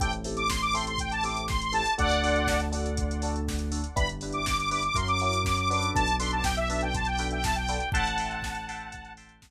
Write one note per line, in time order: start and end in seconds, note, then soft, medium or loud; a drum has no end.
0.00 1.82 A1 medium
0.00 0.10 C4 loud
0.00 0.10 E4 loud
0.00 0.10 G4 loud
0.00 0.10 A4 loud
0.00 0.12 G5 loud
0.00 kick medium
0.00 closed hi-hat loud
0.13 closed hi-hat medium
0.24 0.42 C4 medium
0.24 0.42 E4 medium
0.24 0.42 G4 loud
0.24 0.42 A4 loud
0.24 open hi-hat medium
0.37 0.49 D6 loud
0.37 closed hi-hat medium
0.50 0.61 C6 medium
0.50 kick medium
0.50 snare loud
0.62 0.74 D6 loud
0.62 closed hi-hat medium
0.73 0.92 C4 medium
0.73 0.92 E4 medium
0.73 0.92 G4 medium
0.73 0.92 A4 loud
0.73 0.85 C6 loud
0.73 open hi-hat medium
0.87 0.99 C6 loud
0.87 closed hi-hat medium
0.98 1.11 G5 medium
0.98 kick medium
0.98 closed hi-hat medium
1.12 1.23 A5 loud
1.12 closed hi-hat medium
1.23 1.41 C4 medium
1.23 1.41 E4 medium
1.23 1.41 G4 loud
1.23 1.41 A4 medium
1.23 1.46 D6 medium
1.23 open hi-hat medium
1.37 closed hi-hat medium
1.48 1.61 C6 loud
1.48 kick medium
1.48 snare medium
1.62 1.74 C6 loud
1.62 closed hi-hat medium
1.72 1.81 C4 medium
1.72 1.81 E4 medium
1.72 1.81 G4 medium
1.72 1.81 A4 loud
1.72 1.94 A5 loud
1.72 open hi-hat medium
1.86 closed hi-hat medium
1.98 3.81 D2 loud
1.98 2.07 D4 medium
1.98 2.07 F#4 loud
1.98 2.07 A4 loud
1.98 2.61 D5 loud
1.98 2.61 F#5 loud
1.98 kick medium
1.98 closed hi-hat medium
2.11 closed hi-hat medium
2.23 2.40 D4 medium
2.23 2.40 F#4 medium
2.23 2.40 A4 loud
2.23 open hi-hat medium
2.36 closed hi-hat medium
2.47 kick medium
2.47 snare loud
2.60 closed hi-hat medium
2.72 2.89 D4 medium
2.72 2.89 F#4 medium
2.72 2.89 A4 loud
2.72 open hi-hat medium
2.86 closed hi-hat medium
2.97 kick medium
2.97 closed hi-hat medium
3.11 closed hi-hat medium
3.22 3.40 D4 medium
3.22 3.40 F#4 medium
3.22 3.40 A4 medium
3.22 open hi-hat medium
3.36 closed hi-hat medium
3.48 kick medium
3.48 snare medium
3.59 closed hi-hat medium
3.72 3.80 D4 medium
3.72 3.80 F#4 medium
3.72 3.80 A4 loud
3.72 open hi-hat medium
3.84 closed hi-hat medium
3.96 4.88 G1 medium
3.96 4.05 D4 loud
3.96 4.05 E4 loud
3.96 4.05 G4 loud
3.96 4.05 B4 loud
3.96 4.08 B5 loud
3.96 kick loud
3.96 closed hi-hat medium
4.09 closed hi-hat medium
4.21 4.40 D4 loud
4.21 4.40 E4 loud
4.21 4.40 G4 medium
4.21 4.40 B4 medium
4.21 open hi-hat medium
4.32 4.45 D6 medium
4.32 closed hi-hat medium
4.46 4.57 D6 loud
4.46 kick medium
4.46 snare loud
4.58 4.70 D6 loud
4.58 closed hi-hat medium
4.71 4.80 D4 medium
4.71 4.80 E4 loud
4.71 4.80 G4 medium
4.71 4.80 B4 medium
4.71 4.83 D6 loud
4.71 open hi-hat medium
4.83 4.96 D6 loud
4.83 closed hi-hat medium
4.94 5.86 F#2 medium
4.94 5.04 C#4 loud
4.94 5.04 E4 loud
4.94 5.04 F#4 loud
4.94 5.04 A#4 loud
4.94 5.08 C6 medium
4.94 kick medium
4.94 closed hi-hat loud
5.08 5.20 D6 loud
5.08 closed hi-hat medium
5.20 5.39 C#4 medium
5.20 5.39 E4 loud
5.20 5.39 F#4 loud
5.20 5.39 A#4 medium
5.20 5.43 D6 loud
5.20 open hi-hat medium
5.33 closed hi-hat medium
5.45 5.57 D6 loud
5.45 kick medium
5.45 snare medium
5.57 5.69 D6 loud
5.57 closed hi-hat medium
5.70 6.04 D4 loud
5.70 6.04 F#4 loud
5.70 6.04 A4 loud
5.70 6.04 B4 loud
5.70 5.91 D6 loud
5.70 open hi-hat medium
5.83 closed hi-hat medium
5.94 7.77 B1 medium
5.94 6.16 A5 loud
5.94 kick medium
5.94 closed hi-hat medium
6.08 closed hi-hat medium
6.19 6.37 D4 medium
6.19 6.37 F#4 medium
6.19 6.37 A4 medium
6.19 6.37 B4 loud
6.19 6.31 C6 loud
6.19 open hi-hat medium
6.31 6.44 A5 medium
6.31 closed hi-hat medium
6.44 6.56 G5 loud
6.44 kick medium
6.44 snare loud
6.57 6.69 E5 loud
6.57 closed hi-hat medium
6.70 6.87 D4 loud
6.70 6.87 F#4 medium
6.70 6.87 A4 medium
6.70 6.87 B4 loud
6.70 6.82 E5 medium
6.70 open hi-hat medium
6.81 6.94 G5 loud
6.81 closed hi-hat medium
6.95 7.07 A5 loud
6.95 kick medium
6.95 closed hi-hat medium
7.05 7.28 G5 loud
7.05 closed hi-hat medium
7.18 7.36 D4 medium
7.18 7.36 F#4 medium
7.18 7.36 A4 medium
7.18 7.36 B4 loud
7.18 open hi-hat medium
7.31 7.43 G5 loud
7.31 closed hi-hat medium
7.44 7.56 A5 loud
7.44 kick medium
7.44 snare loud
7.55 7.89 G5 loud
7.55 closed hi-hat medium
7.68 7.77 D4 medium
7.68 7.77 F#4 medium
7.68 7.77 A4 loud
7.68 7.77 B4 medium
7.68 open hi-hat medium
7.80 closed hi-hat medium
7.92 9.50 A1 medium
7.92 8.03 E5 loud
7.92 9.13 F#5 medium
7.92 8.03 G5 loud
7.92 9.13 A5 loud
7.92 8.03 A5 loud
7.92 8.03 C6 loud
7.92 kick loud
7.92 closed hi-hat medium
8.07 closed hi-hat medium
8.18 8.37 E5 medium
8.18 8.37 G5 medium
8.18 8.37 A5 medium
8.18 8.37 C6 medium
8.18 open hi-hat medium
8.31 closed hi-hat medium
8.42 kick medium
8.42 snare loud
8.55 closed hi-hat medium
8.69 8.86 E5 medium
8.69 8.86 G5 medium
8.69 8.86 A5 medium
8.69 8.86 C6 medium
8.69 open hi-hat medium
8.80 closed hi-hat medium
8.92 kick medium
8.92 closed hi-hat medium
9.05 closed hi-hat medium
9.17 9.35 E5 medium
9.17 9.35 G5 medium
9.17 9.35 A5 medium
9.17 9.35 C6 medium
9.17 open hi-hat medium
9.29 closed hi-hat medium
9.42 kick medium
9.42 snare loud